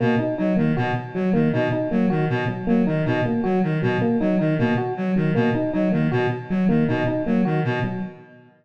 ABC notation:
X:1
M:3/4
L:1/8
Q:1/4=157
K:none
V:1 name="Clarinet" clef=bass
B,, z _G, _E, B,, z | _G, _E, B,, z G, E, | B,, z _G, _E, B,, z | _G, _E, B,, z G, E, |
B,, z _G, _E, B,, z | _G, _E, B,, z G, E, | B,, z _G, _E, B,, z |]
V:2 name="Electric Piano 1"
_B, _E E B, _G z | _G, _B, _E E B, _G | z _G, _B, _E E B, | _G z _G, _B, _E E |
_B, _G z _G, B, _E | _E _B, _G z _G, B, | _E E _B, _G z _G, |]